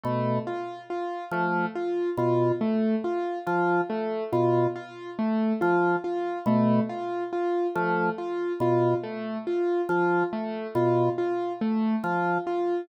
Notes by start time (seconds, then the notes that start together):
0.03 B2 A3
0.47 F4
0.90 F4
1.31 F3 A3
1.75 F4
2.17 B2 F4
2.61 A3
3.04 F4
3.47 F3 F4
3.90 A3
4.33 B2 F4
4.76 F4
5.19 A3
5.61 F3 F4
6.04 F4
6.46 B2 A3
6.89 F4
7.33 F4
7.75 F3 A3
8.18 F4
8.60 B2 F4
9.03 A3
9.47 F4
9.89 F3 F4
10.33 A3
10.75 B2 F4
11.18 F4
11.61 A3
12.04 F3 F4
12.47 F4